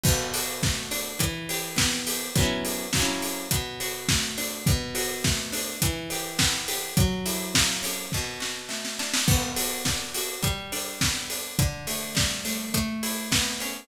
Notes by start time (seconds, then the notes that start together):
0.03 B2, kick, crash
0.34 F#4, open hi-hat
0.63 A3, kick, snare
0.91 D4, open hi-hat
1.19 E3, kick, closed hi-hat
1.49 G4, open hi-hat
1.76 B3, kick, snare
2.07 G4, open hi-hat
2.35 F#3 B3, kick, closed hi-hat
2.40 C#4 E4
2.65 open hi-hat
2.93 F#3, kick, snare
2.97 A#3 C#4
3.02 E4
3.22 open hi-hat
3.51 B2, kick, closed hi-hat
3.80 F#4, open hi-hat
4.09 A3, kick, snare
4.38 D4, open hi-hat
4.66 B2, kick, closed hi-hat
4.95 F#4, open hi-hat
5.24 A3, kick, snare
5.52 D4, open hi-hat
5.82 E3, kick, closed hi-hat
6.10 G4, open hi-hat
6.39 B3, kick, snare
6.68 G4, open hi-hat
6.97 F#3, kick, closed hi-hat
7.26 E4, open hi-hat
7.55 A#3, kick, snare
7.83 C#4, open hi-hat
8.12 B2, kick, snare
8.40 F#4, snare
8.69 A3, snare
8.85 snare
8.99 D4, snare
9.14 snare
9.28 B3, kick, crash
9.56 F#4, open hi-hat
9.85 D4, kick, snare
10.14 F#4, open hi-hat
10.43 G3, kick, closed hi-hat
10.72 D4, open hi-hat
11.01 B3, kick, snare
11.30 D4, open hi-hat
11.59 D3, kick, closed hi-hat
11.87 A3, open hi-hat
12.15 G3, kick, snare
12.45 A3, open hi-hat
12.74 A3, kick, closed hi-hat
13.03 E4, open hi-hat
13.32 B3, kick, snare
13.60 C#4, open hi-hat